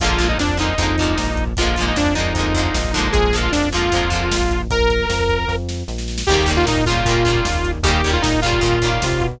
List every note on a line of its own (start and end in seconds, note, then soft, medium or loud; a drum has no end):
0.00 0.35 A#1 loud
0.00 0.18 D3 medium
0.00 0.19 F3 medium
0.00 0.28 F4 loud
0.00 kick loud
0.00 closed hi-hat loud
0.04 0.19 G#3 loud
0.04 0.19 A#3 medium
0.10 kick medium
0.18 0.54 D3 medium
0.18 0.54 F3 medium
0.18 0.54 G#3 medium
0.18 kick medium
0.18 closed hi-hat medium
0.23 0.54 A#3 medium
0.29 0.38 D#4 medium
0.29 kick medium
0.38 0.73 F2 medium
0.38 0.58 D4 medium
0.38 kick medium
0.38 snare loud
0.49 kick medium
0.57 0.75 D3 medium
0.57 0.75 F3 medium
0.57 0.75 G#3 medium
0.57 1.45 D#4 medium
0.57 kick medium
0.57 closed hi-hat medium
0.62 0.75 A#3 medium
0.69 kick medium
0.78 1.14 F2 medium
0.78 0.96 D3 medium
0.78 0.96 F3 medium
0.78 0.96 G#3 medium
0.78 kick medium
0.78 closed hi-hat loud
0.83 0.96 A#3 medium
0.88 kick medium
0.98 1.53 D3 medium
0.98 1.53 F3 medium
0.98 kick medium
0.98 closed hi-hat medium
1.02 1.53 G#3 medium
1.02 1.53 A#3 medium
1.08 kick medium
1.18 1.54 A#1 medium
1.18 kick medium
1.18 snare loud
1.28 kick medium
1.37 kick medium
1.37 closed hi-hat medium
1.47 kick medium
1.57 1.93 A#1 medium
1.57 1.76 D3 medium
1.57 1.76 F3 medium
1.57 1.85 F4 medium
1.57 kick medium
1.57 closed hi-hat loud
1.61 1.76 G#3 medium
1.61 1.76 A#3 medium
1.67 kick medium
1.76 2.13 D3 medium
1.76 2.13 F3 medium
1.76 kick medium
1.76 closed hi-hat medium
1.81 2.13 G#3 medium
1.81 2.13 A#3 medium
1.86 1.97 D#4 medium
1.86 kick medium
1.96 2.32 F2 medium
1.96 2.14 D4 loud
1.96 kick medium
1.96 snare loud
2.06 kick medium
2.15 2.33 D3 medium
2.15 2.33 F3 medium
2.15 2.33 G#3 medium
2.15 3.08 D#4 medium
2.15 kick medium
2.15 closed hi-hat medium
2.20 2.33 A#3 medium
2.25 kick medium
2.34 2.69 F2 medium
2.34 2.54 D3 medium
2.34 2.54 F3 medium
2.34 kick medium
2.34 closed hi-hat loud
2.39 2.54 G#3 medium
2.39 2.54 A#3 medium
2.45 kick medium
2.54 2.92 D3 medium
2.54 2.92 F3 medium
2.54 2.92 G#3 medium
2.54 kick medium
2.54 closed hi-hat medium
2.59 2.92 A#3 medium
2.65 kick medium
2.74 3.09 A#1 medium
2.74 kick medium
2.74 snare loud
2.84 kick medium
2.94 3.32 D3 medium
2.94 3.32 F3 medium
2.94 3.32 G#3 medium
2.94 kick medium
2.94 closed hi-hat medium
2.99 3.32 A#3 medium
3.04 kick medium
3.12 3.49 A#1 loud
3.12 3.36 G#4 loud
3.12 kick loud
3.12 closed hi-hat loud
3.24 kick medium
3.33 3.69 D3 medium
3.33 3.69 F3 medium
3.33 3.69 G#3 medium
3.33 kick medium
3.33 closed hi-hat medium
3.38 3.69 A#3 medium
3.42 3.52 F4 medium
3.42 kick medium
3.52 3.89 F2 medium
3.52 3.69 D4 medium
3.52 kick medium
3.52 snare loud
3.63 kick medium
3.72 3.91 D3 medium
3.72 3.91 F3 medium
3.72 3.91 G#3 medium
3.72 4.62 F4 medium
3.72 kick medium
3.72 closed hi-hat medium
3.77 3.91 A#3 medium
3.83 kick medium
3.92 4.29 F2 medium
3.92 4.10 D3 medium
3.92 4.10 F3 medium
3.92 4.10 G#3 medium
3.92 kick medium
3.92 closed hi-hat loud
3.96 4.10 A#3 medium
4.02 kick medium
4.10 4.64 D3 medium
4.10 4.64 F3 medium
4.10 4.64 G#3 medium
4.10 kick medium
4.10 closed hi-hat medium
4.15 4.64 A#3 medium
4.22 kick medium
4.31 4.67 A#1 medium
4.31 kick medium
4.31 snare loud
4.41 kick medium
4.51 kick medium
4.51 closed hi-hat medium
4.60 kick medium
4.70 5.05 A#1 medium
4.70 5.56 A#4 loud
4.70 kick loud
4.70 closed hi-hat loud
4.80 kick medium
4.90 kick medium
4.90 closed hi-hat medium
5.00 kick medium
5.09 5.45 F2 medium
5.09 kick medium
5.09 snare loud
5.20 kick medium
5.29 kick medium
5.29 closed hi-hat medium
5.39 kick medium
5.48 5.83 F2 medium
5.48 kick medium
5.48 snare medium
5.69 snare medium
5.88 6.23 A#1 medium
5.88 snare medium
5.98 snare medium
6.08 snare medium
6.18 snare loud
6.27 6.64 D#2 loud
6.27 6.46 C#3 medium
6.27 6.47 D#3 medium
6.27 6.51 G4 loud
6.27 kick medium
6.27 crash loud
6.32 6.47 G3 medium
6.32 6.47 A#3 medium
6.37 kick medium
6.46 6.82 C#3 medium
6.46 6.82 D#3 medium
6.46 6.82 G3 medium
6.46 kick medium
6.46 closed hi-hat medium
6.51 6.82 A#3 medium
6.56 6.66 F4 loud
6.56 kick medium
6.66 7.01 A#2 medium
6.66 6.84 D#4 loud
6.66 kick medium
6.66 snare loud
6.76 kick medium
6.86 7.05 C#3 medium
6.86 7.05 D#3 medium
6.86 7.71 F4 loud
6.86 kick medium
6.86 closed hi-hat medium
6.90 7.05 G3 medium
6.90 7.05 A#3 medium
6.96 kick medium
7.05 7.40 A#2 medium
7.05 7.24 C#3 medium
7.05 7.24 D#3 medium
7.05 kick medium
7.05 closed hi-hat loud
7.09 7.24 G3 medium
7.09 7.24 A#3 medium
7.16 kick medium
7.25 7.79 C#3 medium
7.25 7.79 D#3 medium
7.25 7.79 G3 medium
7.25 kick medium
7.25 closed hi-hat medium
7.30 7.79 A#3 medium
7.35 kick medium
7.45 7.81 D#2 medium
7.45 kick medium
7.45 snare loud
7.55 kick medium
7.64 kick medium
7.64 closed hi-hat medium
7.75 kick medium
7.83 8.18 D#2 loud
7.83 8.02 C#3 loud
7.83 8.02 D#3 medium
7.83 8.02 G3 loud
7.83 8.11 G4 medium
7.83 kick loud
7.83 closed hi-hat loud
7.88 8.02 A#3 medium
7.94 kick medium
8.04 8.40 C#3 medium
8.04 8.40 D#3 medium
8.04 8.40 G3 medium
8.04 kick medium
8.04 closed hi-hat medium
8.09 8.40 A#3 medium
8.09 8.22 F4 medium
8.14 kick medium
8.22 8.59 A#2 medium
8.22 8.40 D#4 loud
8.22 kick medium
8.22 snare loud
8.33 kick medium
8.42 8.61 C#3 medium
8.42 8.61 D#3 medium
8.42 9.27 F4 loud
8.42 kick medium
8.42 closed hi-hat medium
8.46 8.61 G3 medium
8.46 8.61 A#3 medium
8.53 kick medium
8.61 8.98 A#2 medium
8.61 8.79 C#3 medium
8.61 8.79 D#3 medium
8.61 8.79 G3 medium
8.61 kick medium
8.61 closed hi-hat medium
8.66 8.79 A#3 medium
8.73 kick medium
8.82 9.36 C#3 medium
8.82 9.36 D#3 medium
8.82 9.36 G3 medium
8.82 kick medium
8.82 closed hi-hat medium
8.86 9.36 A#3 medium
8.92 kick medium
9.02 9.20 C3 medium
9.02 kick medium
9.02 snare loud
9.12 kick medium
9.21 9.39 B2 medium
9.21 kick medium
9.21 closed hi-hat medium
9.31 kick medium